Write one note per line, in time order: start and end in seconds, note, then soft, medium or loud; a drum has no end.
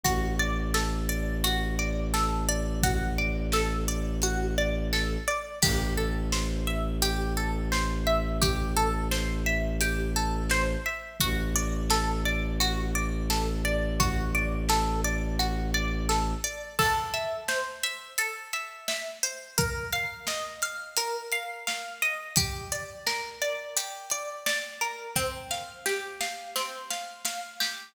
0.03 5.17 A1 loud
0.03 0.36 F#4 medium
0.03 kick medium
0.03 closed hi-hat medium
0.39 0.71 D5 medium
0.74 1.06 A4 medium
0.74 snare loud
1.09 1.40 D5 medium
1.44 1.75 F#4 medium
1.44 closed hi-hat medium
1.79 2.10 D5 medium
2.14 2.45 A4 medium
2.14 snare medium
2.49 2.80 D5 medium
2.83 3.15 F#4 medium
2.83 kick loud
2.83 closed hi-hat loud
3.18 3.50 D5 medium
3.52 3.85 A4 medium
3.52 snare loud
3.88 4.19 D5 medium
4.22 4.54 F#4 medium
4.22 closed hi-hat medium
4.58 4.89 D5 medium
4.93 5.24 A4 medium
4.93 snare medium
5.28 5.59 D5 medium
5.62 10.76 A1 loud
5.62 5.94 G4 medium
5.62 kick loud
5.62 crash loud
5.97 6.29 A4 medium
6.32 6.64 C5 medium
6.32 snare loud
6.67 6.99 E5 medium
7.02 7.33 G4 medium
7.02 closed hi-hat medium
7.37 7.68 A4 medium
7.72 8.03 C5 medium
7.72 snare loud
8.07 8.38 E5 medium
8.42 8.73 G4 medium
8.42 kick loud
8.42 closed hi-hat loud
8.76 9.08 A4 medium
9.11 9.43 C5 medium
9.11 snare loud
9.46 9.78 E5 medium
9.81 10.13 G4 medium
9.81 closed hi-hat loud
10.16 10.47 A4 medium
10.50 10.82 C5 medium
10.50 snare loud
10.86 11.17 E5 medium
11.20 16.34 A1 loud
11.20 11.52 F#4 medium
11.20 kick medium
11.20 closed hi-hat medium
11.56 11.87 D5 medium
11.90 12.22 A4 medium
11.90 snare loud
12.25 12.57 D5 medium
12.60 12.92 F#4 medium
12.60 closed hi-hat medium
12.95 13.26 D5 medium
13.30 13.61 A4 medium
13.30 snare medium
13.65 13.96 D5 medium
14.00 14.31 F#4 medium
14.00 kick loud
14.00 closed hi-hat loud
14.35 14.66 D5 medium
14.69 15.01 A4 medium
14.69 snare loud
15.04 15.36 D5 medium
15.39 15.71 F#4 medium
15.39 closed hi-hat medium
15.74 16.06 D5 medium
16.09 16.40 A4 medium
16.09 snare medium
16.44 16.75 D5 medium
16.79 18.18 A4 medium
16.79 kick medium
16.79 crash loud
17.14 17.83 E5 medium
17.14 closed hi-hat medium
17.48 19.23 C5 medium
17.48 snare loud
17.83 18.53 E5 medium
17.83 closed hi-hat medium
18.18 19.51 A4 medium
18.18 closed hi-hat medium
18.53 18.88 E5 medium
18.53 closed hi-hat medium
18.88 19.54 E5 medium
18.88 snare loud
19.23 19.56 C5 medium
19.23 closed hi-hat medium
19.58 20.97 A#4 medium
19.58 kick loud
19.58 closed hi-hat medium
19.92 20.62 F5 medium
19.92 closed hi-hat medium
20.27 22.02 D#5 medium
20.27 snare loud
20.62 21.32 F5 medium
20.62 closed hi-hat medium
20.97 22.30 A#4 medium
20.97 closed hi-hat loud
21.32 21.67 F5 medium
21.32 closed hi-hat medium
21.67 22.33 F5 medium
21.67 snare medium
22.02 22.35 D#5 medium
22.02 closed hi-hat medium
22.36 23.76 G4 medium
22.36 kick loud
22.36 closed hi-hat loud
22.72 23.41 D5 medium
22.72 closed hi-hat medium
23.07 24.81 A#4 medium
23.07 snare medium
23.42 24.11 D5 medium
23.42 closed hi-hat medium
23.77 25.09 G4 medium
23.77 closed hi-hat loud
24.10 24.46 D5 medium
24.10 closed hi-hat medium
24.46 25.12 D5 medium
24.46 snare loud
24.81 25.14 A#4 medium
24.81 closed hi-hat medium
25.16 26.55 C4 medium
25.16 kick medium
25.16 snare medium
25.51 26.20 F5 medium
25.51 snare medium
25.86 27.60 G4 medium
25.86 snare medium
26.20 26.90 F5 medium
26.20 snare medium
26.56 27.88 C4 medium
26.56 snare medium
26.90 27.25 F5 medium
26.90 snare medium
27.25 27.92 F5 medium
27.25 snare medium
27.60 27.93 G4 medium
27.60 snare loud